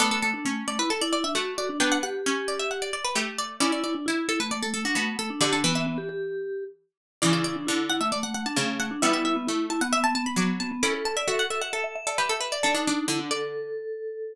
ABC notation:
X:1
M:4/4
L:1/16
Q:1/4=133
K:D
V:1 name="Harpsichord"
A A A4 d B A d d e f2 d2 | g f f4 d e f d d B G2 d2 | d d d4 A B d A A F F2 A2 | d A B e7 z6 |
d d d4 f e d f f a a2 f2 | e e e4 a f e a a b d'2 a2 | d'2 a e e f e f A3 A B A B d | A4 z2 d4 z6 |]
V:2 name="Vibraphone"
A, A, A, D A,2 A, E A E E D F2 F D | D2 G8 z6 | E E E D E2 E A, A, A, A, D A,2 A, D | G D B, B, B, G G6 z4 |
E E E D E2 E A, A, A, A, D A,2 A, D | E E E B, E2 E B, B, B, B, B, B,2 B, B, | A A A d A2 A e e e e d e2 e d | d ^D3 E =D A10 |]
V:3 name="Harpsichord"
[B,D]4 C8 A,4 | [B,D]4 C8 A,4 | [CE]4 E8 B,4 | D,2 E,12 z2 |
[C,E,]4 D,8 C,4 | [G,B,]4 A,8 F,4 | [CE]4 F8 G4 | D D D2 D,8 z4 |]